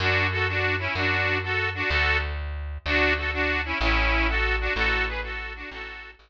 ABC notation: X:1
M:6/8
L:1/8
Q:3/8=126
K:A
V:1 name="Accordion"
[DF]2 [FA] [DF]2 [CE] | [DF]3 [FA]2 [DF] | [FA]2 z4 | [DF]2 [FA] [DF]2 [CE] |
[CE]3 [FA]2 [DF] | [FA]2 [GB] [FA]2 [DF] | [FA]3 z3 |]
V:2 name="Electric Bass (finger)" clef=bass
F,,6 | F,,6 | D,,6 | D,,6 |
A,,,6 | A,,,6 | A,,,3 A,,,3 |]